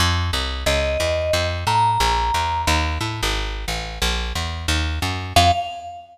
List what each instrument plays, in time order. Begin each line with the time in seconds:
0.00 electric bass (finger) F2
0.33 electric bass (finger) C2
0.66 electric bass (finger) C#2, vibraphone D#5
1.00 electric bass (finger) E2
1.33 electric bass (finger) F2
1.67 electric bass (finger) A2, vibraphone A#5
2.00 electric bass (finger) A#1
2.34 electric bass (finger) E2
2.67 electric bass (finger) D#2
3.01 electric bass (finger) A2
3.23 electric bass (finger) G#1
3.68 electric bass (finger) A1
4.02 electric bass (finger) A#1
4.35 electric bass (finger) E2
4.68 electric bass (finger) D#2
5.02 electric bass (finger) F#2
5.36 electric bass (finger) F2, vibraphone F5